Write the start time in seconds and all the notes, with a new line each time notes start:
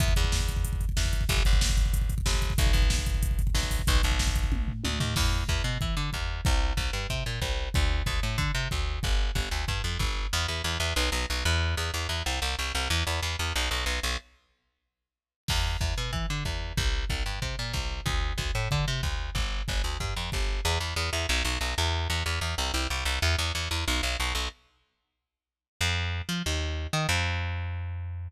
0.00 E2, kick, closed hi-hat
0.08 kick
0.16 E2, kick, closed hi-hat
0.24 kick
0.32 kick, snare
0.40 kick
0.48 kick, closed hi-hat
0.56 kick
0.65 kick, closed hi-hat
0.73 kick
0.81 kick, closed hi-hat
0.89 kick
0.97 E2, kick, snare
1.05 kick
1.13 kick, closed hi-hat
1.21 kick
1.29 G1, kick, closed hi-hat
1.37 kick
1.45 G1, kick, closed hi-hat
1.53 kick
1.61 kick, snare
1.69 kick
1.77 kick, closed hi-hat
1.86 kick
1.93 kick, closed hi-hat
2.01 kick
2.09 kick, closed hi-hat
2.18 kick
2.26 G1, kick, snare
2.34 kick
2.42 kick, closed hi-hat
2.50 kick
2.58 B1, kick, closed hi-hat
2.66 kick
2.73 B1, kick, closed hi-hat
2.82 kick
2.90 kick, snare
2.98 kick
3.06 kick, closed hi-hat
3.14 kick
3.23 kick, closed hi-hat
3.31 kick
3.39 kick, closed hi-hat
3.47 kick
3.55 B1, kick, snare
3.63 kick
3.71 kick, open hi-hat
3.79 kick
3.87 B1, kick, closed hi-hat
3.95 kick
4.03 B1, kick, closed hi-hat
4.11 kick
4.19 kick, snare
4.27 kick
4.36 kick, closed hi-hat
4.44 kick
4.52 kick, high tom
4.68 floor tom
4.84 D2, high tom
5.00 D#2, floor tom
5.16 E2, kick, crash
5.49 E2, kick
5.64 B2
5.81 E3, kick
5.97 D3
6.13 E2, kick
6.45 C2, kick
6.77 C2, kick
6.93 G2
7.10 C3, kick
7.26 A#2
7.42 C2, kick
7.74 D2, kick
8.06 D2, kick
8.23 A2
8.38 D3, kick
8.55 C3
8.71 D2, kick
9.03 G1, kick
9.35 G1, kick
9.51 D2
9.68 G2, kick
9.84 F2
9.99 G1, kick
10.33 E2
10.48 E2
10.64 E2
10.80 E2
10.96 B1
11.12 B1
11.30 B1
11.45 E2
11.77 E2
11.94 E2
12.09 E2
12.26 C2
12.42 C2
12.59 C2
12.75 C2
12.90 E2
13.07 E2
13.23 E2
13.39 E2
13.56 B1
13.71 B1
13.86 B1
14.03 B1
15.48 E2, kick, crash
15.81 E2, kick
15.98 B2
16.13 E3, kick
16.30 D3
16.45 E2, kick
16.77 C2, kick
17.10 C2, kick
17.26 G2
17.42 C3, kick
17.59 A#2
17.73 C2, kick
18.06 D2, kick
18.38 D2, kick
18.55 A2
18.71 D3, kick
18.88 C3
19.03 D2, kick
19.35 G1, kick
19.68 G1, kick
19.84 D2
20.00 G2, kick
20.16 F2
20.32 G1, kick
20.65 E2
20.80 E2
20.96 E2
21.13 E2
21.29 B1
21.45 B1
21.61 B1
21.78 E2
22.10 E2
22.26 E2
22.41 E2
22.58 C2
22.74 C2
22.90 C2
23.05 C2
23.22 E2
23.39 E2
23.55 E2
23.71 E2
23.88 B1
24.03 B1
24.20 B1
24.35 B1
25.81 F2
26.29 F3
26.46 D#2
26.93 D#3
27.09 F2